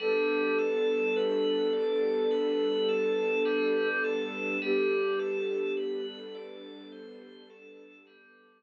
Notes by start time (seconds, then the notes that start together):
0.00 G3 B3 D4 A4
0.59 A4
1.16 B4
1.73 D5
2.31 B4
2.88 A4
3.45 G3
4.04 A4
4.62 G3 B3 D4 G4 A4
5.19 A4
5.77 B4
6.35 D5
6.92 C5
7.50 A4
8.07 G3